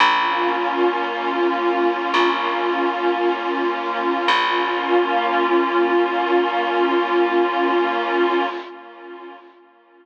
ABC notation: X:1
M:4/4
L:1/8
Q:1/4=56
K:Bbdor
V:1 name="Pad 2 (warm)"
[B,DF]8 | [B,DF]8 |]
V:2 name="Electric Bass (finger)" clef=bass
B,,,4 B,,,4 | B,,,8 |]